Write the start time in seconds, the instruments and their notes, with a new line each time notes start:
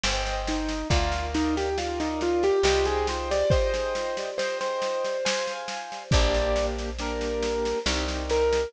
0.03 electric bass (finger) G1, acoustic grand piano C5 D#5 G5, snare
0.26 snare
0.47 acoustic grand piano D#4, snare
0.68 snare
0.90 electric bass (finger) D2, acoustic grand piano F4 A#4 D5 F5, kick, snare
1.12 snare
1.34 acoustic grand piano D#4, snare
1.57 acoustic grand piano G4, snare
1.78 acoustic grand piano F4 A#4 D5 F5, snare
2.00 acoustic grand piano D#4, snare
2.21 acoustic grand piano F4, snare
2.43 acoustic grand piano G4, snare
2.63 electric bass (finger) C2, acoustic grand piano G4 C5 D#5 G5, snare
2.85 acoustic grand piano G#4, snare
3.07 acoustic grand piano C5, snare
3.31 acoustic grand piano D5, snare
3.50 acoustic grand piano C5 D#5 G5, kick, snare
3.74 snare
3.95 snare
4.17 snare
4.38 acoustic grand piano C5 D#5 G5, snare
4.61 acoustic grand piano C5, snare
4.82 snare
5.05 snare
5.25 acoustic grand piano C5 F5 G#5, snare
5.47 snare
5.68 snare
5.92 snare
6.11 electric bass (finger) A#1, acoustic grand piano A#3 D4 G4 D5, kick, snare
6.34 snare
6.56 snare
6.78 snare
6.99 acoustic grand piano A#3 D4 G4 A#4, snare
7.21 snare
7.43 snare
7.65 snare
7.86 electric bass (finger) C2, acoustic grand piano C4 D#4 G4, snare
8.08 snare
8.30 acoustic grand piano A#4, snare
8.53 snare